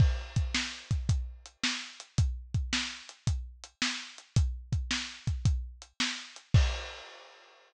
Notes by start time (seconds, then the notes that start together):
0.00 kick, crash
0.36 kick, closed hi-hat
0.54 snare
0.91 kick, closed hi-hat
1.09 kick, closed hi-hat
1.46 closed hi-hat
1.64 snare
2.00 closed hi-hat
2.18 kick, closed hi-hat
2.54 kick, closed hi-hat
2.73 snare
3.09 closed hi-hat
3.27 kick, closed hi-hat
3.64 closed hi-hat
3.82 snare
4.18 closed hi-hat
4.36 kick, closed hi-hat
4.73 kick, closed hi-hat
4.91 snare
5.27 kick, closed hi-hat
5.45 kick, closed hi-hat
5.82 closed hi-hat
6.00 snare
6.36 closed hi-hat
6.54 kick, crash